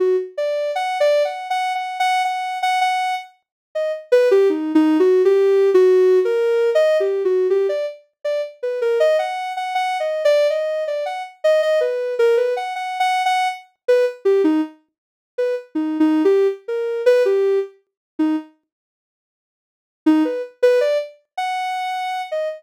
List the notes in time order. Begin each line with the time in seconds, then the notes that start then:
0.00 F#4
0.38 D5
0.75 F#5
1.00 D5
1.25 F#5
1.50 F#5
1.75 F#5
2.00 F#5
2.25 F#5
2.62 F#5
2.81 F#5
3.75 D#5
4.12 B4
4.31 G4
4.50 D#4
4.75 D#4
5.00 F#4
5.25 G4
5.74 F#4
6.25 A#4
6.75 D#5
7.00 G4
7.25 F#4
7.50 G4
7.69 D5
8.25 D5
8.63 B4
8.82 A#4
9.00 D#5
9.19 F#5
9.57 F#5
9.75 F#5
10.00 D#5
10.25 D5
10.50 D#5
10.88 D5
11.06 F#5
11.44 D#5
11.62 D#5
11.81 B4
12.19 A#4
12.37 B4
12.57 F#5
12.76 F#5
13.00 F#5
13.26 F#5
13.88 B4
14.25 G4
14.44 D#4
15.38 B4
15.75 D#4
16.00 D#4
16.25 G4
16.68 A#4
17.06 B4
17.25 G4
18.19 D#4
20.06 D#4
20.25 B4
20.62 B4
20.81 D5
21.38 F#5
22.31 D#5